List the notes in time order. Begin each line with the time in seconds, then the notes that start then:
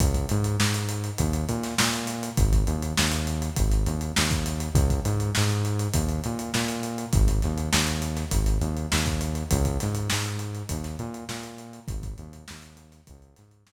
0.00 C#2, kick, closed hi-hat
0.14 kick, closed hi-hat
0.29 G#2, closed hi-hat
0.44 closed hi-hat
0.60 G#2, snare
0.74 closed hi-hat
0.89 closed hi-hat
1.04 closed hi-hat
1.18 D#2, kick, closed hi-hat
1.33 closed hi-hat
1.49 A#2, closed hi-hat
1.63 snare, closed hi-hat
1.78 A#2, snare
1.93 closed hi-hat
2.07 snare, closed hi-hat
2.23 closed hi-hat
2.37 G#1, kick, closed hi-hat
2.53 kick, closed hi-hat
2.67 D#2, closed hi-hat
2.82 closed hi-hat
2.97 D#2, snare
3.12 closed hi-hat
3.27 closed hi-hat
3.42 closed hi-hat
3.56 G#1, kick, closed hi-hat
3.72 closed hi-hat
3.86 D#2, closed hi-hat
4.01 closed hi-hat
4.16 D#2, snare
4.31 kick, closed hi-hat
4.46 closed hi-hat
4.60 closed hi-hat
4.75 C#2, kick, closed hi-hat
4.90 kick, closed hi-hat
5.05 G#2, closed hi-hat
5.20 closed hi-hat
5.35 G#2, snare
5.50 closed hi-hat
5.65 closed hi-hat
5.79 closed hi-hat
5.94 D#2, kick, closed hi-hat
6.09 closed hi-hat
6.24 A#2, closed hi-hat
6.39 closed hi-hat
6.54 A#2, snare
6.68 closed hi-hat
6.83 closed hi-hat
6.98 closed hi-hat
7.13 G#1, kick, closed hi-hat
7.28 kick, closed hi-hat
7.42 D#2, snare, closed hi-hat
7.58 closed hi-hat
7.73 D#2, snare
7.87 closed hi-hat
8.02 closed hi-hat
8.16 snare, closed hi-hat
8.31 G#1, kick, closed hi-hat
8.46 closed hi-hat
8.61 D#2, closed hi-hat
8.77 closed hi-hat
8.92 D#2, snare
9.06 kick, closed hi-hat
9.21 closed hi-hat
9.35 closed hi-hat
9.51 C#2, kick, closed hi-hat
9.65 kick, closed hi-hat
9.80 G#2, snare, closed hi-hat
9.95 closed hi-hat
10.10 G#2, snare
10.25 closed hi-hat
10.39 closed hi-hat
10.55 closed hi-hat
10.69 D#2, kick, closed hi-hat
10.84 snare, closed hi-hat
10.99 A#2, closed hi-hat
11.14 closed hi-hat
11.29 A#2, snare
11.43 closed hi-hat
11.58 closed hi-hat
11.73 closed hi-hat
11.88 G#1, kick, closed hi-hat
12.03 kick, closed hi-hat
12.18 D#2, closed hi-hat
12.33 closed hi-hat
12.48 D#2, snare
12.62 closed hi-hat
12.77 closed hi-hat
12.92 snare, closed hi-hat
13.07 C#2, kick, closed hi-hat
13.22 closed hi-hat
13.36 G#2, snare, closed hi-hat
13.51 closed hi-hat
13.67 G#2, snare